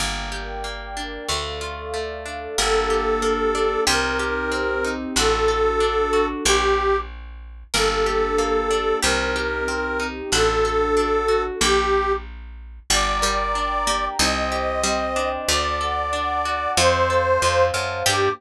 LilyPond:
<<
  \new Staff \with { instrumentName = "Accordion" } { \time 2/4 \key g \minor \tempo 4 = 93 r2 | r2 | a'2 | bes'2 |
a'2 | g'4 r4 | a'2 | bes'2 |
a'2 | g'4 r4 | d''2 | ees''2 |
d''2 | c''4. r8 | g'4 r4 | }
  \new Staff \with { instrumentName = "Harpsichord" } { \time 2/4 \key g \minor r2 | r2 | bes'4. r8 | g'8 r4. |
fis'4. r8 | bes8 r4. | bes'4. r8 | g'8 r4. |
fis'4. r8 | bes8 r4. | g8 g4 bes8 | ees'4 g8 r8 |
a4. r8 | f'8 r4. | g'4 r4 | }
  \new Staff \with { instrumentName = "Orchestral Harp" } { \time 2/4 \key g \minor bes8 g'8 bes8 d'8 | a8 f'8 a8 d'8 | bes8 g'8 bes8 d'8 | c'8 g'8 c'8 ees'8 |
d'8 a'8 d'8 fis'8 | r2 | bes8 g'8 bes8 d'8 | c'8 g'8 c'8 ees'8 |
d'8 a'8 d'8 fis'8 | r2 | d'8 bes'8 d'8 g'8 | c'8 g'8 c'8 d'8~ |
d'8 a'8 d'8 fis'8 | c'8 a'8 c'8 f'8 | <bes d' g'>4 r4 | }
  \new Staff \with { instrumentName = "Electric Bass (finger)" } { \clef bass \time 2/4 \key g \minor g,,2 | d,2 | g,,2 | c,2 |
a,,2 | bes,,2 | g,,2 | c,2 |
a,,2 | bes,,2 | g,,2 | c,2 |
d,2 | f,4 f,8 fis,8 | g,4 r4 | }
  \new Staff \with { instrumentName = "Pad 2 (warm)" } { \time 2/4 \key g \minor <bes' d'' g''>2 | <a' d'' f''>2 | <bes d' g'>2 | <c' ees' g'>2 |
<d' fis' a'>2 | r2 | <bes d' g'>2 | <c' ees' g'>2 |
<d' fis' a'>2 | r2 | <d'' g'' bes''>2 | <c'' ees'' g''>2 |
<d'' fis'' a''>2 | <c'' f'' a''>2 | <bes d' g'>4 r4 | }
>>